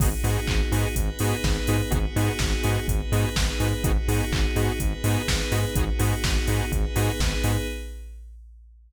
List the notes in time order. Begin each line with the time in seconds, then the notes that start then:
0.00 G#1 B3 D#4 F#4 G#4, kick, crash
0.24 G#2 B3 D#4 F#4 G#4, open hi-hat
0.47 G#1, kick, clap
0.71 G#2 B3 D#4 F#4 G#4, open hi-hat
0.96 G#1 B3 D#4 G#4 B4, kick, closed hi-hat
1.19 G#2 B3 D#4 F#4 G#4, open hi-hat
1.44 G#1, kick, snare
1.67 G#2 B3 D#4 F#4 G#4, open hi-hat
1.91 G#1 B3 D#4 F#4 G#4, kick, closed hi-hat
2.16 G#2 B3 D#4 F#4 G#4, open hi-hat
2.39 G#1, kick, snare
2.63 G#2 B3 D#4 F#4 G#4, open hi-hat
2.88 G#1 B3 D#4 G#4 B4, kick, closed hi-hat
3.12 G#2 B3 D#4 F#4 G#4, open hi-hat
3.36 G#1, kick, snare
3.60 G#2 B3 D#4 F#4 G#4, open hi-hat
3.84 G#1 B3 D#4 F#4 G#4, kick, closed hi-hat
4.08 G#2 B3 D#4 F#4 G#4, open hi-hat
4.32 G#1, kick, clap
4.56 G#2 B3 D#4 F#4 G#4, open hi-hat
4.80 G#1 B3 D#4 G#4 B4, kick, closed hi-hat
5.04 G#2 B3 D#4 F#4 G#4, open hi-hat
5.28 G#1, kick, snare
5.51 G#2 B3 D#4 F#4 G#4, open hi-hat
5.75 G#1 B3 D#4 F#4 G#4, kick, closed hi-hat
5.99 G#2 B3 D#4 F#4 G#4, open hi-hat
6.24 G#1, kick, snare
6.47 G#2 B3 D#4 F#4 G#4, open hi-hat
6.71 G#1 B3 D#4 G#4 B4, kick, closed hi-hat
6.95 G#2 B3 D#4 F#4 G#4, open hi-hat
7.20 G#1, kick, snare
7.44 G#2 B3 D#4 F#4 G#4, open hi-hat